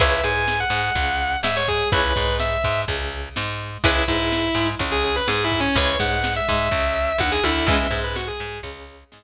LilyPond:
<<
  \new Staff \with { instrumentName = "Distortion Guitar" } { \time 4/4 \key cis \minor \tempo 4 = 125 e''8 gis''8. fis''4.~ fis''16 e''16 cis''16 gis'8 | b'4 e''4 r2 | e'8 e'4. r16 gis'16 gis'16 b'16 \tuplet 3/2 { gis'8 e'8 cis'8 } | cis''8 fis''8. e''4.~ e''16 fis''16 gis'16 e'8 |
e''8. b'16 fis'16 gis'8. r2 | }
  \new Staff \with { instrumentName = "Acoustic Guitar (steel)" } { \time 4/4 \key cis \minor <e' gis' b' cis''>8 gis4 gis8 cis4 gis4 | <e' gis' b' cis''>8 gis4 gis8 cis4 gis4 | <e' gis' b' cis''>8 gis4 gis8 cis4 gis4 | <e' gis' b' cis''>8 gis4 gis8 cis4 dis8 d8 |
<e gis b cis'>8 gis4 gis8 cis4 gis4 | }
  \new Staff \with { instrumentName = "Electric Bass (finger)" } { \clef bass \time 4/4 \key cis \minor cis,8 gis,4 gis,8 cis,4 gis,4 | cis,8 gis,4 gis,8 cis,4 gis,4 | cis,8 gis,4 gis,8 cis,4 gis,4 | cis,8 gis,4 gis,8 cis,4 dis,8 d,8 |
cis,8 gis,4 gis,8 cis,4 gis,4 | }
  \new DrumStaff \with { instrumentName = "Drums" } \drummode { \time 4/4 <hh bd>8 hh8 sn8 hh8 <hh bd>8 hh8 sn8 <hh bd>8 | <hh bd>8 <hh bd>8 sn8 <hh bd>8 <hh bd>8 hh8 sn8 hh8 | <hh bd>8 <hh bd>8 sn8 hh8 <hh bd>8 hh8 sn8 <hho bd>8 | <hh bd>8 <hh bd>8 sn8 <hh bd>8 <hh bd>8 hh8 <bd tommh>8 tommh8 |
<cymc bd>8 <hh bd>8 sn8 hh8 <hh bd>8 hh8 sn4 | }
>>